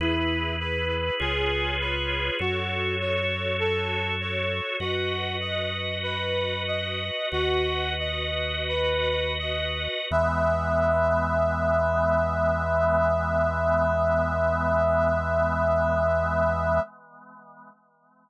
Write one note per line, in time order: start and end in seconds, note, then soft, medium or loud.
0.00 1.10 E2 medium
0.00 0.56 E4 medium
0.00 1.20 E4 medium
0.00 1.19 G#4 medium
0.00 1.19 B4 medium
0.60 1.15 B4 medium
1.20 2.31 C#2 medium
1.20 2.39 F4 loud
1.20 2.39 G#4 medium
1.20 1.76 G#4 medium
1.20 2.39 B4 medium
1.20 2.39 C#5 medium
1.80 2.35 B4 medium
2.39 4.61 F#2 medium
2.39 4.77 F#4 medium
2.39 2.95 F#4 medium
2.39 4.77 A4 medium
2.39 4.77 C#5 medium
3.00 3.56 C#5 medium
3.60 4.15 A4 medium
4.21 4.76 C#5 medium
4.80 7.11 F#2 medium
4.80 5.36 F#4 medium
4.80 7.29 F#4 medium
4.80 7.29 B4 medium
4.80 7.29 D#5 medium
5.40 5.98 D#5 medium
6.03 6.62 B4 medium
6.67 7.27 D#5 medium
7.32 9.88 D#2 medium
7.32 10.08 F#4 medium
7.32 7.94 F#4 medium
7.32 10.08 B4 medium
7.32 10.08 D#5 medium
7.99 8.63 D#5 medium
8.69 9.33 B4 medium
9.39 10.06 D#5 medium
10.11 16.80 E2 loud
10.11 16.81 E3 medium
10.11 16.81 G#3 loud
10.11 16.81 B3 loud
10.11 16.80 E5 loud